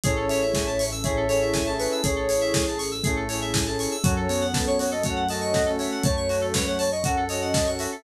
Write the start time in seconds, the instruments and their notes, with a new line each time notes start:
0.04 synth bass 1 A1, lead 2 (sawtooth) C#4 E4 G#4 A4, pad 2 (warm) C#4 E4 G#4 A4, electric piano 2 G#4, flute C#5, ocarina C#5, kick, closed hi-hat
0.16 electric piano 2 A4
0.28 electric piano 2 C#5, flute E5, open hi-hat
0.42 electric piano 2 E5
0.54 electric piano 2 G#5, kick, snare
0.67 electric piano 2 A5
0.79 electric piano 2 C#6, open hi-hat
0.92 electric piano 2 E6
1.03 lead 2 (sawtooth) C#4 E4 G#4 A4, electric piano 2 G#4, ocarina C#5, flute E5, kick, closed hi-hat
1.17 electric piano 2 A4
1.29 lead 2 (sawtooth) C#4 E4 G#4 A4, electric piano 2 C#5, ocarina C#5, open hi-hat
1.42 electric piano 2 E5
1.54 electric piano 2 G#5, kick, snare
1.66 lead 2 (sawtooth) C#4 E4 G#4 A4, electric piano 2 A5
1.79 ocarina B4, electric piano 2 C#6, open hi-hat
1.92 electric piano 2 E6
2.04 synth bass 1 A1, flute G#4, electric piano 2 G#4, ocarina C#5, kick, closed hi-hat
2.16 electric piano 2 A4
2.29 electric piano 2 C#5, open hi-hat
2.41 electric piano 2 E5
2.54 electric piano 2 G#5, kick, snare
2.67 electric piano 2 A5
2.78 electric piano 2 C#6, open hi-hat
2.91 electric piano 2 E6
3.04 flute A3, lead 2 (sawtooth) C#4 E4 G#4 A4, electric piano 2 G#4, kick, closed hi-hat
3.16 electric piano 2 A4
3.29 lead 2 (sawtooth) C#4 E4 G#4 A4, electric piano 2 C#5, open hi-hat
3.42 electric piano 2 E5
3.54 electric piano 2 G#5, kick, snare
3.66 lead 2 (sawtooth) C#4 E4 G#4 A4, electric piano 2 A5
3.79 electric piano 2 C#6, open hi-hat
3.91 electric piano 2 E6
4.03 synth bass 1 F#2, flute F#3, lead 2 (sawtooth) C#4 F#4 A4, pad 2 (warm) C#4 F#4 A4, electric piano 2 F#4, ocarina C#5, kick, closed hi-hat
4.16 electric piano 2 A4
4.29 flute B3, electric piano 2 C#5, open hi-hat
4.41 electric piano 2 F#5
4.54 ocarina B4, electric piano 2 A5, kick, snare
4.67 ocarina C#5, electric piano 2 C#6
4.79 electric piano 2 F#4, ocarina C#5, open hi-hat
4.91 electric piano 2 A4, ocarina D#5
5.04 flute A3, lead 2 (sawtooth) C#4 F#4 A4, electric piano 2 C#5, ocarina F#5, kick, closed hi-hat
5.16 electric piano 2 F#5
5.29 lead 2 (sawtooth) C#4 F#4 A4, ocarina D#5, electric piano 2 A5, open hi-hat
5.41 electric piano 2 C#6
5.54 electric piano 2 F#4, kick, snare
5.66 lead 2 (sawtooth) C#4 F#4 A4, electric piano 2 A4
5.79 electric piano 2 C#5, ocarina E5, open hi-hat
5.91 electric piano 2 F#5
6.04 synth bass 1 F#2, flute A3, ocarina C#5, electric piano 2 A5, kick, closed hi-hat
6.17 electric piano 2 C#6
6.29 electric piano 2 F#4, open hi-hat
6.41 electric piano 2 A4
6.54 ocarina B4, electric piano 2 C#5, kick, snare
6.67 ocarina C#5, electric piano 2 F#5
6.79 ocarina C#5, electric piano 2 A5, open hi-hat
6.92 ocarina D#5, electric piano 2 C#6
7.04 lead 2 (sawtooth) C#4 F#4 A4, electric piano 2 F#4, ocarina F#5, kick, closed hi-hat
7.17 electric piano 2 A4
7.29 lead 2 (sawtooth) C#4 F#4 A4, electric piano 2 C#5, ocarina D#5, open hi-hat
7.42 electric piano 2 F#5
7.54 electric piano 2 A5, kick, snare
7.67 lead 2 (sawtooth) C#4 F#4 A4, electric piano 2 C#6
7.79 electric piano 2 F#4, ocarina E5, open hi-hat
7.92 electric piano 2 A4